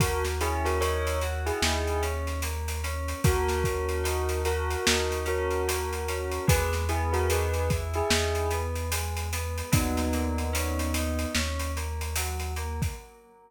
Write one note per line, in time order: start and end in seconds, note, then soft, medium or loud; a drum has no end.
0.00 1.51 D#2 loud
0.00 0.38 A#3 medium
0.00 0.24 F#4 medium
0.00 0.24 A#4 medium
0.00 kick loud
0.00 closed hi-hat loud
0.24 snare medium
0.24 closed hi-hat medium
0.41 0.78 C#4 medium
0.41 0.64 E4 medium
0.41 0.64 G#4 medium
0.41 closed hi-hat medium
0.65 0.80 F#4 medium
0.65 0.80 A#4 medium
0.65 snare soft
0.65 closed hi-hat medium
0.81 1.18 D#4 medium
0.81 1.18 A#4 medium
0.81 1.18 C#5 medium
0.81 closed hi-hat medium
1.07 closed hi-hat medium
1.21 1.60 F#4 medium
1.21 closed hi-hat medium
1.46 2.02 E4 medium
1.46 2.02 G#4 medium
1.46 closed hi-hat medium
1.62 3.14 D#2 loud
1.62 2.01 D#4 medium
1.62 snare loud
1.87 closed hi-hat medium
2.02 2.40 C#4 medium
2.02 closed hi-hat medium
2.27 snare soft
2.27 closed hi-hat medium
2.42 2.81 A#3 medium
2.42 closed hi-hat medium
2.68 closed hi-hat medium
2.84 3.21 C#4 medium
2.84 closed hi-hat medium
3.08 closed hi-hat medium
3.24 4.76 D#2 loud
3.24 3.62 A#3 medium
3.24 4.40 F#4 medium
3.24 4.40 A#4 medium
3.24 kick loud
3.24 closed hi-hat loud
3.48 snare medium
3.48 closed hi-hat medium
3.64 4.03 C#4 medium
3.64 kick medium
3.64 closed hi-hat medium
3.89 closed hi-hat medium
4.04 4.41 D#4 medium
4.04 closed hi-hat medium
4.29 closed hi-hat medium
4.45 5.18 F#4 medium
4.45 4.83 F#4 medium
4.45 5.18 A#4 medium
4.45 closed hi-hat medium
4.70 closed hi-hat medium
4.87 6.39 D#2 medium
4.87 5.24 D#4 medium
4.87 snare loud
5.11 snare soft
5.11 closed hi-hat medium
5.25 5.63 C#4 medium
5.25 6.45 F#4 medium
5.25 6.45 A#4 medium
5.25 closed hi-hat medium
5.51 closed hi-hat medium
5.68 6.05 A#3 medium
5.68 closed hi-hat loud
5.93 closed hi-hat medium
6.08 6.46 C#4 medium
6.08 closed hi-hat medium
6.31 closed hi-hat medium
6.47 8.02 E2 loud
6.47 6.85 G#3 medium
6.47 6.72 G#4 medium
6.47 6.72 B4 medium
6.47 kick loud
6.47 closed hi-hat loud
6.73 snare medium
6.73 closed hi-hat medium
6.89 7.26 B3 medium
6.89 7.12 E4 medium
6.89 7.12 G#4 medium
6.89 closed hi-hat medium
7.13 7.28 F#4 medium
7.13 7.28 A#4 medium
7.13 closed hi-hat medium
7.30 7.68 D#4 medium
7.30 7.68 G#4 medium
7.30 7.68 B4 medium
7.30 closed hi-hat loud
7.54 closed hi-hat medium
7.70 8.08 E4 medium
7.70 kick medium
7.70 closed hi-hat medium
7.94 8.50 E4 medium
7.94 8.50 G#4 medium
7.94 closed hi-hat medium
8.10 9.62 E2 loud
8.10 8.47 D#4 medium
8.10 snare loud
8.35 closed hi-hat medium
8.51 8.89 B3 medium
8.51 closed hi-hat medium
8.76 closed hi-hat medium
8.91 9.29 G#3 medium
8.91 closed hi-hat loud
9.17 closed hi-hat medium
9.33 9.70 B3 medium
9.33 closed hi-hat medium
9.58 closed hi-hat medium
9.72 11.26 D#2 loud
9.72 10.09 F#3 loud
9.72 11.27 B3 medium
9.72 11.27 D#4 medium
9.72 kick loud
9.72 closed hi-hat loud
9.97 snare medium
9.97 closed hi-hat medium
10.13 10.51 A#3 medium
10.13 closed hi-hat medium
10.38 closed hi-hat medium
10.53 10.90 C#4 medium
10.53 closed hi-hat loud
10.79 closed hi-hat medium
10.94 11.32 D#4 medium
10.94 closed hi-hat loud
11.19 closed hi-hat medium
11.34 12.87 D#2 loud
11.34 11.72 C#4 medium
11.34 snare loud
11.59 closed hi-hat medium
11.76 12.14 A#3 medium
11.76 closed hi-hat medium
12.01 closed hi-hat medium
12.16 12.54 F#3 medium
12.16 closed hi-hat loud
12.40 closed hi-hat medium
12.56 12.94 A#3 medium
12.56 closed hi-hat medium
12.82 kick medium
12.82 closed hi-hat medium